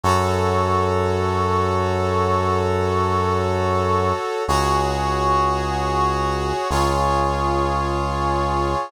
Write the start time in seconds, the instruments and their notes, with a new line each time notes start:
0.03 synth bass 1 F#2, brass section F#4 A4 C#5
4.48 synth bass 1 C#2, brass section F#4 G#4 C#5
6.70 synth bass 1 C#2, brass section F4 G#4 C#5